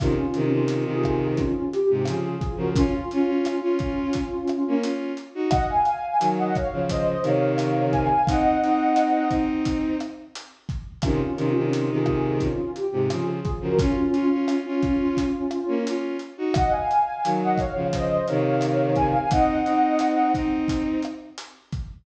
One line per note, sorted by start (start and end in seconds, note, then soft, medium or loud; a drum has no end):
0.00 0.16 C3 medium
0.00 0.16 D#3 loud
0.00 0.44 C#4 medium
0.00 0.44 F4 medium
0.00 kick loud
0.00 cross-stick loud
0.00 closed hi-hat loud
0.34 0.51 C3 loud
0.34 0.51 D#3 loud
0.34 closed hi-hat medium
0.45 0.83 C#4 medium
0.45 0.83 F4 medium
0.52 0.84 C3 medium
0.52 0.84 D#3 loud
0.68 closed hi-hat loud
0.85 1.41 C3 medium
0.85 1.41 D#3 loud
0.91 1.34 F4 medium
0.91 1.34 G#4 medium
1.04 kick medium
1.04 cross-stick medium
1.37 1.69 C#4 medium
1.37 1.69 F4 medium
1.37 kick medium
1.37 closed hi-hat medium
1.72 2.02 G4 medium
1.72 closed hi-hat medium
1.90 2.06 G#2 medium
1.90 2.06 C3 medium
2.05 2.35 C#3 medium
2.05 2.35 F3 medium
2.05 2.23 F4 medium
2.05 2.23 G#4 medium
2.05 cross-stick medium
2.05 closed hi-hat loud
2.24 2.55 F4 medium
2.24 2.55 G#4 medium
2.41 kick medium
2.41 closed hi-hat medium
2.56 2.73 C#3 medium
2.56 2.73 F3 loud
2.56 2.74 F#4 medium
2.56 2.74 A#4 medium
2.75 3.31 C#4 medium
2.75 2.93 C#4 loud
2.75 3.31 F4 loud
2.75 2.93 F4 loud
2.75 kick loud
2.75 closed hi-hat loud
3.11 3.27 C#4 loud
3.11 3.27 F4 loud
3.11 closed hi-hat medium
3.27 3.55 C#4 medium
3.27 3.55 F4 loud
3.43 3.60 C#4 medium
3.43 3.60 F4 medium
3.43 cross-stick medium
3.43 closed hi-hat loud
3.61 4.75 C#4 medium
3.61 4.19 C#4 medium
3.61 4.75 F4 medium
3.61 4.19 F4 loud
3.79 kick medium
3.79 closed hi-hat medium
4.13 kick medium
4.13 closed hi-hat loud
4.48 cross-stick medium
4.48 closed hi-hat medium
4.68 4.84 A#3 medium
4.68 4.82 C#4 loud
4.82 5.12 C#4 medium
4.82 5.12 F4 loud
4.82 closed hi-hat loud
5.17 closed hi-hat medium
5.35 5.51 D#4 medium
5.35 5.51 F#4 loud
5.50 5.67 D#5 medium
5.50 5.67 F#5 loud
5.50 kick loud
5.50 cross-stick loud
5.50 closed hi-hat loud
5.68 6.27 F5 medium
5.68 6.27 G#5 medium
5.85 closed hi-hat medium
6.20 6.51 D#3 medium
6.20 6.51 F#3 medium
6.20 closed hi-hat loud
6.38 6.55 D#5 medium
6.38 6.55 F#5 medium
6.55 6.84 C#5 medium
6.55 6.84 F5 medium
6.55 kick medium
6.55 cross-stick medium
6.55 closed hi-hat medium
6.72 7.14 C#3 medium
6.72 7.14 F3 medium
6.89 7.23 C5 medium
6.89 7.23 D#5 medium
6.89 kick medium
6.89 closed hi-hat loud
7.22 8.08 C3 loud
7.22 8.08 D#3 loud
7.22 7.92 C#5 medium
7.22 7.91 F5 medium
7.22 closed hi-hat medium
7.58 cross-stick medium
7.58 closed hi-hat loud
7.91 8.07 F5 medium
7.91 8.07 G#5 medium
7.91 kick medium
7.91 closed hi-hat medium
8.10 8.26 F5 medium
8.10 8.26 G#5 medium
8.27 8.56 C4 loud
8.27 8.56 D#4 loud
8.27 9.30 D#5 medium
8.27 9.30 F#5 medium
8.27 kick loud
8.27 closed hi-hat loud
8.63 9.28 C4 loud
8.63 9.28 D#4 loud
8.63 closed hi-hat medium
8.96 cross-stick medium
8.96 closed hi-hat loud
9.30 9.96 C4 medium
9.30 9.96 D#4 loud
9.30 kick medium
9.30 closed hi-hat medium
9.65 kick medium
9.65 closed hi-hat loud
10.00 cross-stick medium
10.00 closed hi-hat medium
10.35 closed hi-hat loud
10.69 kick medium
10.69 closed hi-hat medium
11.02 11.20 C3 medium
11.02 11.20 D#3 loud
11.02 11.47 C#4 medium
11.02 11.47 F4 medium
11.02 kick loud
11.02 cross-stick loud
11.02 closed hi-hat loud
11.37 11.53 C3 loud
11.37 11.53 D#3 loud
11.37 closed hi-hat medium
11.50 11.89 C#4 medium
11.50 11.89 F4 medium
11.56 11.90 C3 medium
11.56 11.90 D#3 loud
11.73 closed hi-hat loud
11.91 12.47 C3 medium
11.91 12.47 D#3 loud
11.95 12.37 F4 medium
11.95 12.37 G#4 medium
12.06 kick medium
12.06 cross-stick medium
12.40 12.71 C#4 medium
12.40 12.71 F4 medium
12.40 kick medium
12.40 closed hi-hat medium
12.76 13.06 G4 medium
12.76 closed hi-hat medium
12.93 13.09 G#2 medium
12.93 13.09 C3 medium
13.10 13.40 C#3 medium
13.10 13.40 F3 medium
13.10 13.26 F4 medium
13.10 13.26 G#4 medium
13.10 cross-stick medium
13.10 closed hi-hat loud
13.26 13.58 F4 medium
13.26 13.58 G#4 medium
13.45 kick medium
13.45 closed hi-hat medium
13.61 13.77 C#3 medium
13.61 13.77 F3 loud
13.61 13.79 F#4 medium
13.61 13.79 A#4 medium
13.79 13.95 C#4 loud
13.79 14.34 C#4 medium
13.79 13.95 F4 loud
13.79 14.34 F4 loud
13.79 kick loud
13.79 closed hi-hat loud
14.13 14.29 C#4 loud
14.13 14.29 F4 loud
14.13 closed hi-hat medium
14.32 14.60 C#4 medium
14.32 14.60 F4 loud
14.48 14.64 C#4 medium
14.48 14.64 F4 medium
14.48 cross-stick medium
14.48 closed hi-hat loud
14.66 15.79 C#4 medium
14.66 15.23 C#4 medium
14.66 15.79 F4 medium
14.66 15.23 F4 loud
14.82 kick medium
14.82 closed hi-hat medium
15.17 kick medium
15.17 closed hi-hat loud
15.51 cross-stick medium
15.51 closed hi-hat medium
15.68 15.84 A#3 medium
15.68 15.84 C#4 loud
15.87 16.17 C#4 medium
15.87 16.17 F4 loud
15.87 closed hi-hat loud
16.19 closed hi-hat medium
16.37 16.54 D#4 medium
16.37 16.54 F#4 loud
16.54 16.72 D#5 medium
16.54 16.72 F#5 loud
16.54 kick loud
16.54 cross-stick loud
16.54 closed hi-hat loud
16.71 17.30 F5 medium
16.71 17.30 G#5 medium
16.91 closed hi-hat medium
17.24 17.56 D#3 medium
17.24 17.56 F#3 medium
17.24 closed hi-hat loud
17.42 17.59 D#5 medium
17.42 17.59 F#5 medium
17.58 17.87 C#5 medium
17.58 17.87 F5 medium
17.58 kick medium
17.58 cross-stick medium
17.58 closed hi-hat medium
17.75 18.17 C#3 medium
17.75 18.17 F3 medium
17.93 18.26 C5 medium
17.93 18.26 D#5 medium
17.93 kick medium
17.93 closed hi-hat loud
18.27 19.14 C3 loud
18.27 19.14 D#3 loud
18.27 18.95 C#5 medium
18.27 18.95 F5 medium
18.27 closed hi-hat medium
18.61 cross-stick medium
18.61 closed hi-hat loud
18.96 19.12 F5 medium
18.96 19.12 G#5 medium
18.96 kick medium
18.96 closed hi-hat medium
19.13 19.29 F5 medium
19.13 19.29 G#5 medium
19.31 19.60 C4 loud
19.31 19.60 D#4 loud
19.31 20.32 D#5 medium
19.31 20.32 F#5 medium
19.31 kick loud
19.31 closed hi-hat loud
19.66 20.31 C4 loud
19.66 20.31 D#4 loud
19.66 closed hi-hat medium
19.99 cross-stick medium
19.99 closed hi-hat loud
20.34 21.00 C4 medium
20.34 21.00 D#4 loud
20.34 kick medium
20.34 closed hi-hat medium
20.68 kick medium
20.68 closed hi-hat loud
21.02 cross-stick medium
21.02 closed hi-hat medium
21.38 closed hi-hat loud
21.72 kick medium
21.72 closed hi-hat medium